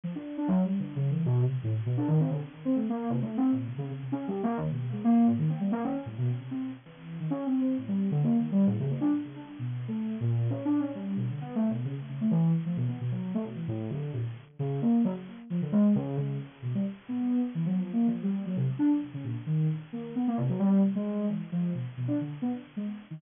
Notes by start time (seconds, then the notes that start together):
0.04 F3
0.15 D4
0.37 D4
0.48 F#3
0.65 G3
0.79 D3
0.96 C#3
1.10 E3
1.26 B2
1.41 C3
1.63 A2
1.86 B2
1.97 D4
2.08 D#3
2.20 C4
2.30 D3
2.65 C4
2.75 A3
2.89 A#3
3.10 C3
3.22 A3
3.37 C4
3.52 A#2
3.67 C3
3.78 C#3
3.90 C#3
4.02 C3
4.12 C#4
4.28 G3
4.43 A#3
4.57 D#3
4.70 B2
4.92 G#3
5.04 A#3
5.27 A2
5.38 D#3
5.49 C4
5.60 G3
5.72 A#3
5.84 C#4
5.95 C#4
6.06 A2
6.18 B2
6.40 C3
6.51 C4
6.85 E3
7.20 D#3
7.30 C#4
7.46 C4
7.61 C4
7.78 A2
7.88 G3
8.11 D3
8.23 A#3
8.37 D#3
8.52 G3
8.67 A2
8.80 C#3
8.91 A#3
9.01 D4
9.24 C#3
9.36 D4
9.59 B2
9.88 A3
10.20 A#2
10.50 C#4
10.65 D4
10.80 C#4
10.95 G3
11.16 B2
11.30 D3
11.41 B3
11.55 A3
11.70 B2
11.85 C#3
12.09 C#3
12.21 A3
12.31 E3
12.66 F3
12.77 B2
12.88 B3
13.00 B2
13.11 F#3
13.34 A3
13.44 B2
13.55 E3
13.68 A2
13.90 D3
14.13 A#2
14.59 C#3
14.82 A#3
15.04 F#3
15.50 F3
15.62 D3
15.72 G#3
15.95 C#3
16.17 C#3
16.62 B2
16.75 G3
17.09 B3
17.55 E3
17.66 F#3
17.78 F3
17.93 A#3
18.07 F3
18.22 G3
18.46 F#3
18.56 C3
18.79 D4
19.14 C#3
19.23 A#2
19.46 D#3
19.93 A#3
20.15 B3
20.27 A#3
20.37 C3
20.49 F#3
20.59 G3
20.95 G#3
21.29 E3
21.52 F3
21.74 B2
21.97 B2
22.08 D4
22.21 D3
22.42 B3
22.76 G#3
23.11 D#3